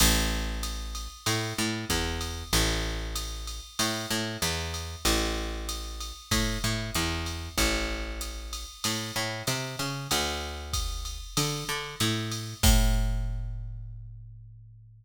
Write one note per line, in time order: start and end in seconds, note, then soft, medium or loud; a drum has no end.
0.00 1.08 A1 loud
0.00 crash loud
0.00 ride loud
0.63 hi-hat pedal medium
0.63 ride medium
0.95 ride medium
1.26 1.53 A2 medium
1.26 ride medium
1.58 1.85 A2 medium
1.89 2.44 E2 medium
1.89 kick medium
1.89 hi-hat pedal medium
1.89 ride medium
2.21 ride medium
2.53 3.60 A1 loud
2.53 ride loud
3.16 hi-hat pedal medium
3.16 ride medium
3.47 ride medium
3.79 4.06 A2 medium
3.79 ride loud
4.10 4.37 A2 medium
4.42 4.96 E2 medium
4.42 hi-hat pedal medium
4.42 ride medium
4.74 ride medium
5.05 6.12 A1 medium
5.05 ride loud
5.69 hi-hat pedal medium
5.69 ride medium
6.01 ride medium
6.31 6.58 A2 medium
6.31 kick medium
6.31 ride loud
6.64 6.91 A2 medium
6.94 7.49 E2 medium
6.94 hi-hat pedal medium
6.94 ride medium
7.26 ride medium
7.58 8.65 A1 medium
7.58 kick medium
7.58 ride medium
8.21 hi-hat pedal medium
8.21 ride medium
8.53 ride medium
8.84 9.12 A2 medium
8.84 ride loud
9.16 9.43 A2 medium
9.47 9.76 C3 medium
9.47 hi-hat pedal medium
9.47 ride medium
9.79 10.08 C#3 medium
9.79 ride medium
10.11 11.19 D2 medium
10.11 ride loud
10.73 kick medium
10.73 hi-hat pedal medium
10.73 ride medium
11.05 ride medium
11.37 11.64 D3 medium
11.37 ride loud
11.69 11.96 D3 medium
12.00 12.54 A2 medium
12.00 hi-hat pedal medium
12.00 ride medium
12.31 ride medium
12.63 15.05 A2 loud
12.63 kick loud
12.63 crash loud